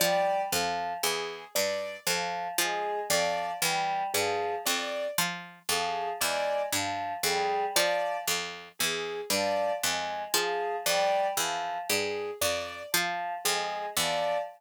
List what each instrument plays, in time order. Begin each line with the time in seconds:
0.00 harpsichord F3, choir aahs G3, acoustic grand piano D5
0.52 harpsichord F2, choir aahs F3
1.03 harpsichord E2, acoustic grand piano G#4
1.55 harpsichord G2, acoustic grand piano D5
2.07 harpsichord F2, choir aahs F3
2.58 harpsichord F3, choir aahs G#3, acoustic grand piano G#4
3.10 harpsichord F2, choir aahs F3, acoustic grand piano D5
3.62 harpsichord E2, choir aahs G3
4.13 harpsichord G2, choir aahs F3, acoustic grand piano G#4
4.66 harpsichord F2, acoustic grand piano D5
5.18 harpsichord F3
5.69 harpsichord F2, choir aahs F3, acoustic grand piano G#4
6.20 harpsichord E2, choir aahs G#3, acoustic grand piano D5
6.72 harpsichord G2, choir aahs F3
7.23 harpsichord F2, choir aahs G3, acoustic grand piano G#4
7.76 choir aahs F3, harpsichord F3, acoustic grand piano D5
8.28 harpsichord F2
8.79 harpsichord E2, acoustic grand piano G#4
9.30 harpsichord G2, choir aahs F3, acoustic grand piano D5
9.82 harpsichord F2, choir aahs G#3
10.34 harpsichord F3, choir aahs F3, acoustic grand piano G#4
10.86 harpsichord F2, choir aahs G3, acoustic grand piano D5
11.37 harpsichord E2, choir aahs F3
11.89 harpsichord G2, acoustic grand piano G#4
12.41 harpsichord F2, acoustic grand piano D5
12.92 choir aahs F3, harpsichord F3
13.44 harpsichord F2, choir aahs G#3, acoustic grand piano G#4
13.97 harpsichord E2, choir aahs F3, acoustic grand piano D5